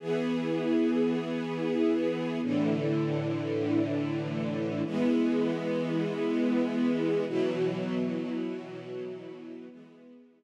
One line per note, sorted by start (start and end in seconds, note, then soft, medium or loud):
0.00 2.40 E3 medium
0.00 2.40 B3 medium
0.00 2.40 G#4 medium
2.42 4.82 A2 medium
2.42 4.82 D3 medium
2.42 4.82 E3 medium
4.85 7.25 E3 medium
4.85 7.25 G#3 medium
4.85 7.25 B3 medium
7.27 9.67 B2 medium
7.27 9.67 E3 medium
7.27 9.67 F#3 medium
9.69 10.43 E3 medium
9.69 10.43 G#3 medium
9.69 10.43 B3 medium